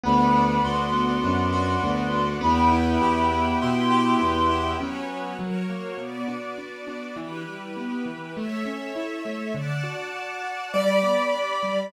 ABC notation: X:1
M:4/4
L:1/8
Q:1/4=101
K:Am
V:1 name="Clarinet"
b2 c'6 | b4 c'4 | [K:Bm] z8 | z8 |
z8 |]
V:2 name="Acoustic Grand Piano"
z8 | z8 | [K:Bm] z8 | z8 |
z4 d4 |]
V:3 name="Acoustic Grand Piano"
B, D ^F B, D F B, D | B, E G B, E G B, E | [K:Bm] [F,B,C]2 F, ^A, B,, D D D | E, G, B, E, A, C E A, |
D, F F F G, B, D G, |]
V:4 name="Violin" clef=bass
D,,2 D,,2 ^F,,2 D,,2 | E,,2 E,,2 B,,2 E,,2 | [K:Bm] z8 | z8 |
z8 |]
V:5 name="String Ensemble 1"
[Bd^f]8 | [Beg]8 | [K:Bm] [FBc]2 [F^Ac]2 [B,Fd]4 | [EGB]4 [Ace]4 |
[dfa]4 [Gdb]4 |]